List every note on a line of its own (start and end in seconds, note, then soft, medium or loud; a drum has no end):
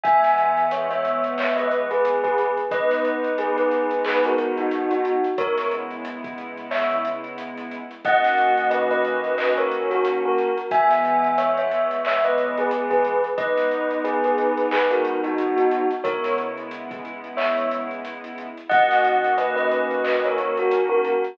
0.03 2.46 E3 loud
0.03 2.46 G#3 loud
0.03 2.46 B3 medium
0.03 0.68 E5 medium
0.03 0.68 G#5 medium
0.03 kick loud
0.03 closed hi-hat loud
0.24 snare medium
0.24 closed hi-hat medium
0.38 closed hi-hat medium
0.57 closed hi-hat medium
0.71 0.91 C#5 medium
0.71 0.91 E5 medium
0.71 closed hi-hat loud
0.91 1.34 C#5 medium
0.91 1.34 E5 medium
0.91 closed hi-hat medium
1.05 closed hi-hat medium
1.24 closed hi-hat medium
1.38 1.58 C#5 medium
1.38 1.58 E5 medium
1.38 clap loud
1.56 1.87 B4 medium
1.56 1.87 D#5 medium
1.56 closed hi-hat medium
1.71 closed hi-hat medium
1.91 2.21 G#4 medium
1.91 2.21 B4 medium
1.91 closed hi-hat medium
2.05 closed hi-hat loud
2.24 2.54 G#4 medium
2.24 2.54 B4 medium
2.24 kick medium
2.24 closed hi-hat medium
2.38 closed hi-hat medium
2.57 closed hi-hat medium
2.71 5.13 G#3 loud
2.71 5.13 B3 medium
2.71 5.13 D#4 loud
2.71 3.29 B4 medium
2.71 3.29 D#5 medium
2.71 kick loud
2.71 closed hi-hat loud
2.91 snare medium
2.91 closed hi-hat medium
3.05 closed hi-hat medium
3.24 closed hi-hat medium
3.38 3.56 G#4 medium
3.38 3.56 B4 medium
3.38 closed hi-hat loud
3.56 3.97 G#4 medium
3.56 3.97 B4 medium
3.56 closed hi-hat medium
3.71 closed hi-hat medium
3.91 closed hi-hat medium
4.05 4.24 G#4 medium
4.05 4.24 B4 medium
4.05 clap loud
4.24 4.52 F#4 medium
4.24 4.52 A#4 medium
4.24 closed hi-hat medium
4.38 closed hi-hat medium
4.57 4.90 D#4 medium
4.57 4.90 F#4 medium
4.57 closed hi-hat medium
4.71 closed hi-hat loud
4.91 5.21 D#4 medium
4.91 5.21 F#4 medium
4.91 closed hi-hat medium
5.05 closed hi-hat loud
5.24 closed hi-hat medium
5.38 7.79 C#3 medium
5.38 7.79 G#3 medium
5.38 7.79 B3 medium
5.38 7.79 E4 loud
5.38 5.67 A#4 medium
5.38 5.67 C#5 medium
5.38 kick loud
5.38 closed hi-hat loud
5.58 snare medium
5.58 closed hi-hat medium
5.71 closed hi-hat medium
5.91 closed hi-hat medium
6.05 closed hi-hat loud
6.24 kick loud
6.24 closed hi-hat medium
6.38 closed hi-hat medium
6.57 closed hi-hat medium
6.71 7.00 C#5 medium
6.71 7.00 E5 medium
6.71 clap loud
6.91 closed hi-hat medium
7.04 snare soft
7.04 closed hi-hat loud
7.24 closed hi-hat medium
7.38 closed hi-hat loud
7.58 closed hi-hat medium
7.71 closed hi-hat medium
7.91 closed hi-hat medium
8.05 10.46 D#3 medium
8.05 10.46 A#3 loud
8.05 10.46 C#4 medium
8.05 10.46 F#4 medium
8.05 8.67 D#5 medium
8.05 8.67 F#5 medium
8.05 kick loud
8.05 closed hi-hat loud
8.24 snare medium
8.24 closed hi-hat medium
8.38 closed hi-hat medium
8.57 closed hi-hat medium
8.70 8.89 B4 medium
8.70 8.89 D#5 medium
8.70 closed hi-hat loud
8.91 9.32 B4 medium
8.91 9.32 D#5 medium
8.91 closed hi-hat medium
9.05 closed hi-hat medium
9.24 closed hi-hat medium
9.38 9.57 B4 medium
9.38 9.57 D#5 medium
9.38 clap loud
9.57 9.88 A#4 medium
9.57 9.88 C#5 medium
9.57 closed hi-hat medium
9.71 closed hi-hat medium
9.91 10.16 F#4 medium
9.91 10.16 A#4 medium
9.91 closed hi-hat medium
10.05 closed hi-hat loud
10.25 10.56 F#4 medium
10.25 10.56 A#4 medium
10.38 closed hi-hat medium
10.57 closed hi-hat medium
10.71 13.13 E3 loud
10.71 13.13 G#3 loud
10.71 13.13 B3 medium
10.71 11.36 E5 medium
10.71 11.36 G#5 medium
10.71 kick loud
10.71 closed hi-hat loud
10.91 snare medium
10.91 closed hi-hat medium
11.05 closed hi-hat medium
11.24 closed hi-hat medium
11.38 11.56 C#5 medium
11.38 11.56 E5 medium
11.38 closed hi-hat loud
11.57 12.02 C#5 medium
11.57 12.02 E5 medium
11.57 closed hi-hat medium
11.71 closed hi-hat medium
11.91 closed hi-hat medium
12.05 12.25 C#5 medium
12.05 12.25 E5 medium
12.05 clap loud
12.24 12.56 B4 medium
12.24 12.56 D#5 medium
12.24 closed hi-hat medium
12.38 closed hi-hat medium
12.57 12.88 G#4 medium
12.57 12.88 B4 medium
12.57 closed hi-hat medium
12.71 closed hi-hat loud
12.90 13.21 G#4 medium
12.90 13.21 B4 medium
12.90 kick medium
12.90 closed hi-hat medium
13.04 closed hi-hat medium
13.24 closed hi-hat medium
13.38 15.79 G#3 loud
13.38 15.79 B3 medium
13.38 15.79 D#4 loud
13.38 13.95 B4 medium
13.38 13.95 D#5 medium
13.38 kick loud
13.38 closed hi-hat loud
13.58 snare medium
13.58 closed hi-hat medium
13.71 closed hi-hat medium
13.91 closed hi-hat medium
14.04 14.23 G#4 medium
14.04 14.23 B4 medium
14.04 closed hi-hat loud
14.24 14.66 G#4 medium
14.24 14.66 B4 medium
14.24 closed hi-hat medium
14.38 closed hi-hat medium
14.57 closed hi-hat medium
14.71 14.91 G#4 medium
14.71 14.91 B4 medium
14.71 clap loud
14.91 15.18 F#4 medium
14.91 15.18 A#4 medium
14.91 closed hi-hat medium
15.05 closed hi-hat medium
15.23 15.56 D#4 medium
15.23 15.56 F#4 medium
15.23 closed hi-hat medium
15.38 closed hi-hat loud
15.56 15.86 D#4 medium
15.56 15.86 F#4 medium
15.56 closed hi-hat medium
15.71 closed hi-hat loud
15.91 closed hi-hat medium
16.04 18.46 C#3 medium
16.04 18.46 G#3 medium
16.04 18.46 B3 medium
16.04 18.46 E4 loud
16.04 16.33 A#4 medium
16.04 16.33 C#5 medium
16.04 kick loud
16.04 closed hi-hat loud
16.24 snare medium
16.24 closed hi-hat medium
16.38 closed hi-hat medium
16.57 closed hi-hat medium
16.71 closed hi-hat loud
16.91 kick loud
16.91 closed hi-hat medium
17.05 closed hi-hat medium
17.24 closed hi-hat medium
17.37 17.66 C#5 medium
17.37 17.66 E5 medium
17.37 clap loud
17.58 closed hi-hat medium
17.71 snare soft
17.71 closed hi-hat loud
17.91 closed hi-hat medium
18.05 closed hi-hat loud
18.24 closed hi-hat medium
18.38 closed hi-hat medium
18.57 closed hi-hat medium
18.69 21.12 D#3 medium
18.69 21.12 A#3 loud
18.69 21.12 C#4 medium
18.69 21.12 F#4 medium
18.69 19.31 D#5 medium
18.69 19.31 F#5 medium
18.69 kick loud
18.69 closed hi-hat loud
18.91 snare medium
18.91 closed hi-hat medium
19.04 closed hi-hat medium
19.24 closed hi-hat medium
19.38 19.55 B4 medium
19.38 19.55 D#5 medium
19.38 closed hi-hat loud
19.56 19.97 B4 medium
19.56 19.97 D#5 medium
19.56 closed hi-hat medium
19.71 closed hi-hat medium
19.91 closed hi-hat medium
20.04 20.23 B4 medium
20.04 20.23 D#5 medium
20.04 clap loud
20.24 20.56 A#4 medium
20.24 20.56 C#5 medium
20.24 closed hi-hat medium
20.38 closed hi-hat medium
20.57 20.85 F#4 medium
20.57 20.85 A#4 medium
20.57 closed hi-hat medium
20.71 closed hi-hat loud
20.89 21.19 F#4 medium
20.89 21.19 A#4 medium
21.04 closed hi-hat medium
21.24 closed hi-hat medium